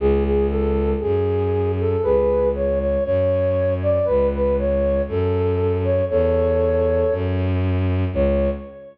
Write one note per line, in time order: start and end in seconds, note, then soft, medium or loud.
0.00 0.94 C#2 loud
0.00 0.24 G#4 loud
0.25 0.47 G#4 loud
0.49 0.91 A4 loud
1.00 1.95 F#2 medium
1.00 1.72 G#4 loud
1.80 2.03 A4 loud
2.03 2.97 C#2 medium
2.03 2.49 G#4 loud
2.03 2.49 B4 loud
2.55 2.79 C#5 loud
2.80 3.04 C#5 loud
3.04 3.99 F#2 medium
3.04 3.74 C#5 loud
3.82 4.06 D5 loud
4.05 5.01 C#2 medium
4.05 4.27 B4 loud
4.33 4.54 B4 loud
4.59 5.02 C#5 loud
5.08 6.01 F#2 medium
5.08 5.77 A4 loud
5.84 6.05 C#5 loud
6.10 7.03 E2 loud
6.10 7.14 A4 loud
6.10 7.14 C#5 loud
7.11 8.05 F#2 loud
8.13 8.48 C#2 loud
8.13 8.50 C#5 loud